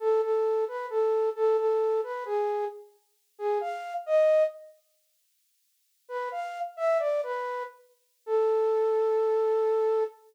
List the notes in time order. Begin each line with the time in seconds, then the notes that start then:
0.00 A4
0.22 A4
0.68 B4
0.90 A4
1.36 A4
1.57 A4
2.03 B4
2.25 G#4
3.39 G#4
3.61 F5
4.06 D#5
6.09 B4
6.32 F5
6.77 E5
6.99 D5
7.23 B4
8.26 A4